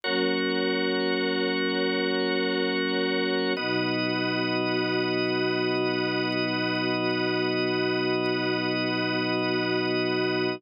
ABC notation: X:1
M:4/4
L:1/8
Q:1/4=68
K:Alyd
V:1 name="Choir Aahs"
[F,^A,C]8 | [B,,F,D]8- | [B,,F,D]8 |]
V:2 name="Drawbar Organ"
[F^Ac]8 | [B,Fd]8- | [B,Fd]8 |]